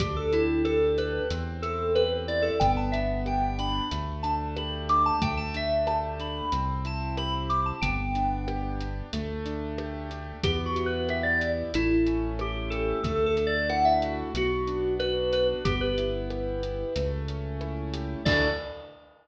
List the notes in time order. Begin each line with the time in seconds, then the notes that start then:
0.00 D2 D4 G4, kick, closed hi-hat
0.16 A4
0.33 E4 G4, closed hi-hat
0.65 A4, cross-stick
0.98 G4 B4, closed hi-hat
1.30 E2 C4, closed hi-hat
1.62 E4 A4, closed hi-hat
1.95 G4 B4, cross-stick
2.28 E4 D5, closed hi-hat
2.42 A4
2.60 G1 B3 G5, kick, closed hi-hat
2.77 A5
2.92 D4 E5, closed hi-hat
3.26 G4 G5, cross-stick
3.59 D4 B5, closed hi-hat
3.91 D2 A3, closed hi-hat
4.23 D4 A5, closed hi-hat
4.57 G4 B5, cross-stick
4.89 D4 D6, closed hi-hat
5.06 A5
5.22 D2 A3 G5, kick, closed hi-hat
5.37 A5
5.54 D4 E5, closed hi-hat
5.87 G4 A5, cross-stick
6.20 D4 B5, closed hi-hat
6.52 C2 C4, closed hi-hat
6.85 E4 A5, closed hi-hat
7.17 G4 B5, cross-stick
7.49 E4 D6, closed hi-hat
7.66 A5
7.82 G1 B3 G5, kick, closed hi-hat
8.15 D4, closed hi-hat
8.48 G4, cross-stick
8.80 D4, closed hi-hat
9.13 D2 A3, closed hi-hat
9.46 D4, closed hi-hat
9.78 G4, cross-stick
10.11 D4, closed hi-hat
10.43 E2 B3 G4, kick, closed hi-hat
10.66 F#4
10.76 E4, closed hi-hat
10.86 B4
11.09 G4 E5, cross-stick
11.23 D5
11.41 E4, closed hi-hat
11.74 A1 A3 E4, closed hi-hat
12.07 C#4, closed hi-hat
12.39 E4 G4, cross-stick
12.70 G4 A4, closed hi-hat
13.03 D2 A3 A4, kick, closed hi-hat
13.26 A4
13.37 D4, closed hi-hat
13.47 D5
13.69 E4 F#5, cross-stick
13.85 E5
14.02 F#4, closed hi-hat
14.34 B1 B3 F#4, closed hi-hat
14.67 D4, closed hi-hat
14.99 F#4 B4, cross-stick
15.32 D4 B4, closed hi-hat
15.65 G1 B3 G4, kick, closed hi-hat
15.81 B4
15.98 E4, closed hi-hat
16.30 G4, cross-stick
16.63 E4, closed hi-hat
16.96 C#2 A3, closed hi-hat
17.28 C#4, closed hi-hat
17.61 E4, cross-stick
17.94 G4, closed hi-hat
18.25 D2 D4 E4 F#4 A4 D5, kick, crash